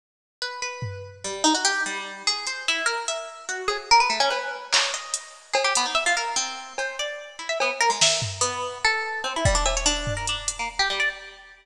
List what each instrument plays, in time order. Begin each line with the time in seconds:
0.42 orchestral harp B4
0.62 orchestral harp B4
0.82 floor tom
1.24 orchestral harp G3
1.44 orchestral harp D#4
1.55 orchestral harp F#4
1.65 orchestral harp G4
1.86 orchestral harp G3
2.27 orchestral harp G#4
2.47 orchestral harp C5, closed hi-hat
2.68 orchestral harp E4
2.86 orchestral harp A#4
3.08 orchestral harp E5
3.49 orchestral harp F#4
3.68 orchestral harp G#4, cowbell
3.91 orchestral harp A#4
4.00 orchestral harp B4
4.10 orchestral harp A3
4.20 orchestral harp C#4
4.30 orchestral harp B4, cowbell
4.73 orchestral harp C#5, clap
4.94 orchestral harp D#5
5.14 closed hi-hat
5.54 orchestral harp G#4, cowbell
5.64 orchestral harp G4
5.75 orchestral harp B3, closed hi-hat
5.86 orchestral harp D#4
5.95 orchestral harp E5
6.06 orchestral harp F4
6.17 orchestral harp A#4
6.36 orchestral harp C4
6.78 orchestral harp C5, cowbell
6.99 orchestral harp D5
7.39 orchestral harp E4
7.49 orchestral harp E5
7.60 orchestral harp B3, cowbell
7.81 orchestral harp A#4
7.90 orchestral harp G#3
8.01 orchestral harp E5, snare
8.22 floor tom
8.41 orchestral harp B3
8.85 orchestral harp A4
9.24 orchestral harp C4, cowbell
9.36 orchestral harp E4
9.45 orchestral harp G3, kick
9.55 orchestral harp D4
9.66 orchestral harp E5, cowbell
9.77 orchestral harp C#5
9.86 orchestral harp D4
10.07 floor tom
10.17 orchestral harp A#4
10.27 orchestral harp D4, closed hi-hat
10.48 closed hi-hat
10.59 orchestral harp A#3
10.79 orchestral harp G4
10.90 orchestral harp G3
11.00 orchestral harp D5